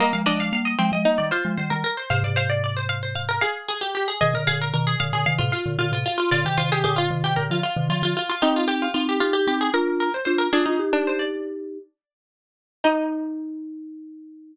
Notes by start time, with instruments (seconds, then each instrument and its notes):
0.00 marimba G3 A#3, pizzicato strings A#3, harpsichord D#5
0.13 marimba F3 G#3, harpsichord F5
0.26 marimba F3 G#3, pizzicato strings D4, harpsichord D#5
0.40 harpsichord F5
0.53 marimba G3 A#3, harpsichord F5
0.65 harpsichord D#5
0.79 marimba F3 G#3, pizzicato strings C4
0.92 marimba F3 G#3, harpsichord D#5
1.05 marimba G3 A#3, pizzicato strings D#4
1.18 marimba D#3 G3, harpsichord D5
1.31 pizzicato strings F4, harpsichord C5
1.45 marimba F3 G#3
1.57 marimba D#3 G3, harpsichord C5
1.70 marimba D#3 G3, harpsichord A#4
1.84 harpsichord A#4
1.97 harpsichord C5
2.10 marimba G#2 C3, harpsichord C5, pizzicato strings F5
2.24 marimba G#2 C3, harpsichord D5
2.36 harpsichord C5, pizzicato strings F5
2.50 harpsichord D5
2.64 harpsichord D5
2.77 harpsichord C5
2.89 pizzicato strings F5
3.03 harpsichord C5
3.15 pizzicato strings F5
3.29 harpsichord A#4
3.41 harpsichord G#4, pizzicato strings F5
3.68 harpsichord G#4
3.81 harpsichord G4
3.95 harpsichord G4
4.08 harpsichord G#4
4.21 marimba B2 D#3, harpsichord G#4, pizzicato strings D#5
4.34 marimba A#2 D3, harpsichord A#4
4.47 marimba A#2 D3, harpsichord G#4, pizzicato strings F5
4.62 harpsichord A#4
4.74 marimba B2 D#3, harpsichord A#4
4.87 harpsichord G#4
5.00 marimba A#2 D3, pizzicato strings F5
5.13 marimba A#2 D3, harpsichord G#4
5.26 marimba C3 D#3, pizzicato strings F5
5.38 marimba A2 C3, harpsichord F4
5.52 harpsichord F4, pizzicato strings F5
5.66 marimba A#2 D3
5.79 marimba A#2 D3, harpsichord F4
5.92 marimba A2 C3, harpsichord F4
6.06 harpsichord F4
6.18 harpsichord F4
6.31 marimba A#2 D3, harpsichord F4, pizzicato strings D5
6.45 marimba C3 D#3, harpsichord G4
6.57 marimba C3 D#3, harpsichord F4, pizzicato strings C5
6.72 harpsichord G4, pizzicato strings G#4
6.84 marimba A#2 D3, harpsichord G4, pizzicato strings G#4
6.96 harpsichord F4, pizzicato strings F4
7.11 marimba C3 D#3
7.24 marimba C3 D#3, harpsichord G4
7.36 marimba A#2 D3, pizzicato strings A#4
7.50 marimba D3 F3, harpsichord F4
7.63 harpsichord F4
7.76 marimba C3 D#3
7.89 marimba D3 F3, harpsichord F4
8.03 marimba D3 F3, harpsichord F4
8.17 harpsichord F4
8.29 harpsichord F4
8.42 marimba C4 D#4, pizzicato strings D#4, harpsichord G4
8.56 harpsichord F4
8.68 pizzicato strings G4, harpsichord G4
8.82 harpsichord F4
8.94 marimba C4 D#4, harpsichord F4
9.09 harpsichord G4
9.20 marimba D#4 G4, pizzicato strings F4
9.33 harpsichord G4
9.47 marimba C4 D#4, pizzicato strings G4
9.61 harpsichord G#4
9.74 marimba D4 F4, harpsichord A#4, pizzicato strings A#4
10.00 harpsichord A#4
10.14 harpsichord C5
10.25 marimba D4 F4, harpsichord C5
10.38 harpsichord A#4
10.53 marimba D4 F4, pizzicato strings D4, harpsichord G#4
10.66 marimba D4 F4, pizzicato strings D#4
10.79 marimba D#4 G4
10.93 pizzicato strings D4, marimba D#4 G4
11.07 harpsichord C5
11.19 harpsichord D5
12.84 pizzicato strings D#4, marimba D#4, harpsichord D#5